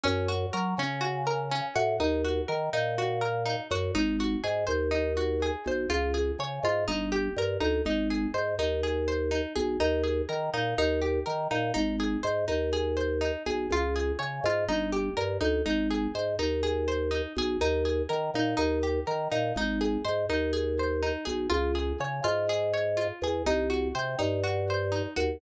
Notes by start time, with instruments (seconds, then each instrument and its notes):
0.03 drawbar organ F#2, harpsichord C#4
0.28 harpsichord F#4
0.53 drawbar organ F#3, harpsichord A#4
0.78 drawbar organ C#3, harpsichord C#4
1.01 harpsichord F#4
1.27 harpsichord A#4
1.51 harpsichord C#4
1.76 drawbar organ A2, harpsichord F#4
2.00 drawbar organ D#2, harpsichord D#4
2.24 harpsichord F#4
2.48 drawbar organ D#3, harpsichord A#4
2.73 drawbar organ A#2, harpsichord D#4
2.98 harpsichord F#4
3.21 harpsichord A#4
3.46 harpsichord D#4
3.71 drawbar organ F#2, harpsichord F#4
3.95 drawbar organ G#1, harpsichord D#4
4.20 harpsichord F#4
4.44 drawbar organ G#2, harpsichord G#4
4.67 drawbar organ D#2, harpsichord C5
4.91 harpsichord D#4
5.17 harpsichord F#4
5.42 harpsichord G#4
5.66 drawbar organ B1, harpsichord C5
5.90 drawbar organ C#2, harpsichord F4
6.14 harpsichord G#4
6.39 drawbar organ C#3, harpsichord C#5
6.63 drawbar organ G#2, harpsichord F4
6.88 drawbar organ G1, harpsichord D#4
7.12 harpsichord G4
7.37 drawbar organ G2, harpsichord A#4
7.60 drawbar organ D2, harpsichord D#4
7.85 drawbar organ G#1, harpsichord D#4
8.10 harpsichord G#4
8.34 drawbar organ G#2, harpsichord C5
8.59 drawbar organ D#2, harpsichord D#4
8.83 harpsichord G#4
9.08 harpsichord C5
9.31 harpsichord D#4
9.56 drawbar organ B1, harpsichord G#4
9.80 drawbar organ D#2, harpsichord D#4
10.03 harpsichord G#4
10.29 drawbar organ D#3, harpsichord A#4
10.54 drawbar organ A#2, harpsichord D#4
10.78 drawbar organ D#2, harpsichord D#4
11.02 harpsichord G4
11.26 drawbar organ D#3, harpsichord A#4
11.51 drawbar organ A#2, harpsichord D#4
11.74 drawbar organ G#1, harpsichord D#4
12.00 harpsichord G#4
12.23 drawbar organ G#2, harpsichord C5
12.48 drawbar organ D#2, harpsichord D#4
12.73 harpsichord G#4
12.97 harpsichord C5
13.21 harpsichord D#4
13.46 drawbar organ B1, harpsichord G#4
13.71 drawbar organ C#2, harpsichord F4
13.96 harpsichord G#4
14.19 drawbar organ C#3, harpsichord C#5
14.44 drawbar organ G#2, harpsichord F4
14.68 drawbar organ G1, harpsichord D#4
14.92 harpsichord G4
15.17 drawbar organ G2, harpsichord A#4
15.41 drawbar organ D2, harpsichord D#4
15.66 drawbar organ G#1, harpsichord D#4
15.91 harpsichord G#4
16.15 drawbar organ G#2, harpsichord C5
16.39 drawbar organ D#2, harpsichord D#4
16.63 harpsichord G#4
16.88 harpsichord C5
17.11 harpsichord D#4
17.36 drawbar organ B1, harpsichord G#4
17.61 drawbar organ D#2, harpsichord D#4
17.85 harpsichord G#4
18.09 drawbar organ D#3, harpsichord A#4
18.34 drawbar organ A#2, harpsichord D#4
18.57 drawbar organ D#2, harpsichord D#4
18.83 harpsichord G4
19.07 drawbar organ D#3, harpsichord A#4
19.32 drawbar organ A#2, harpsichord D#4
19.56 drawbar organ G#1, harpsichord D#4
19.81 harpsichord G#4
20.05 drawbar organ G#2, harpsichord C5
20.29 drawbar organ D#2, harpsichord D#4
20.53 harpsichord G#4
20.79 harpsichord C5
21.03 harpsichord D#4
21.25 drawbar organ B1, harpsichord G#4
21.50 drawbar organ C#2, harpsichord F4
21.75 harpsichord G#4
22.00 drawbar organ C#3, harpsichord C#5
22.24 drawbar organ G#2, harpsichord F4
22.49 harpsichord G#4
22.74 harpsichord C#5
22.97 harpsichord F4
23.22 drawbar organ E2, harpsichord G#4
23.46 drawbar organ C2, harpsichord D#4
23.70 harpsichord F#4
23.95 drawbar organ C3, harpsichord C5
24.19 drawbar organ G2, harpsichord D#4
24.43 harpsichord F#4
24.70 harpsichord C5
24.92 harpsichord D#4
25.16 drawbar organ D#2, harpsichord F#4